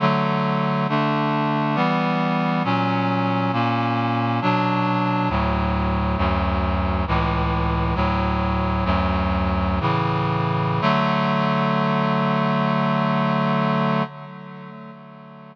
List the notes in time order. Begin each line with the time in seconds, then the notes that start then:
0.00 D3 F#3 A3
0.89 D3 A3 D4
1.75 E3 G3 B3
2.64 A#2 F#3 C#4
3.53 A#2 A#3 C#4
4.42 B2 F#3 D4
5.29 D2 A2 F#3
6.17 D2 F#2 F#3
7.07 C#2 A2 E3
7.95 D2 A2 F#3
8.85 D2 F#2 F#3
9.80 A2 C#3 E3
10.81 D3 F#3 A3